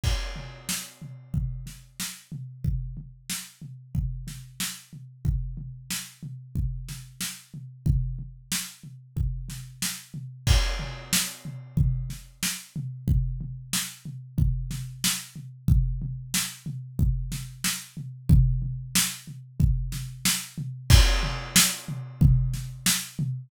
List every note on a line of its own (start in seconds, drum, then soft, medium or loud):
0.04 kick medium
0.04 crash medium
0.36 floor tom medium
0.69 snare medium
1.02 floor tom medium
1.34 kick medium
1.34 floor tom medium
1.66 snare soft
1.66 floor tom soft
2.00 snare medium
2.32 floor tom medium
2.64 kick medium
2.64 floor tom medium
2.97 floor tom medium
3.30 snare medium
3.62 floor tom medium
3.95 kick medium
3.95 floor tom medium
4.27 snare soft
4.27 floor tom medium
4.60 snare medium
4.93 floor tom soft
5.25 kick medium
5.25 floor tom medium
5.57 floor tom medium
5.90 snare medium
6.23 floor tom medium
6.55 kick medium
6.55 floor tom medium
6.89 snare soft
6.89 floor tom medium
7.21 snare medium
7.54 floor tom medium
7.86 kick medium
7.86 floor tom loud
8.19 floor tom soft
8.52 snare medium
8.84 floor tom soft
9.17 kick medium
9.17 floor tom medium
9.49 snare soft
9.49 floor tom medium
9.82 snare medium
10.14 floor tom medium
10.47 kick loud
10.47 crash loud
10.79 floor tom medium
11.13 snare loud
11.45 floor tom medium
11.77 kick medium
11.77 floor tom loud
12.10 snare soft
12.10 floor tom medium
12.43 snare loud
12.76 floor tom medium
13.08 kick medium
13.08 floor tom loud
13.41 floor tom medium
13.73 snare loud
14.05 floor tom medium
14.38 kick medium
14.38 floor tom loud
14.71 snare soft
14.71 floor tom medium
15.04 snare loud
15.36 floor tom medium
15.68 kick loud
15.68 floor tom loud
16.02 floor tom medium
16.34 snare loud
16.66 floor tom medium
16.99 kick medium
16.99 floor tom loud
17.32 snare medium
17.32 floor tom medium
17.64 snare loud
17.97 floor tom medium
18.29 kick loud
18.29 floor tom loud
18.62 floor tom medium
18.95 snare loud
19.27 floor tom medium
19.60 kick loud
19.60 floor tom loud
19.92 snare medium
19.92 floor tom medium
20.25 snare loud
20.58 floor tom medium
20.90 kick loud
20.90 crash loud
21.23 floor tom medium
21.56 snare loud
21.88 floor tom medium
22.21 kick loud
22.21 floor tom loud
22.54 snare soft
22.54 floor tom medium
22.86 snare loud
23.19 floor tom loud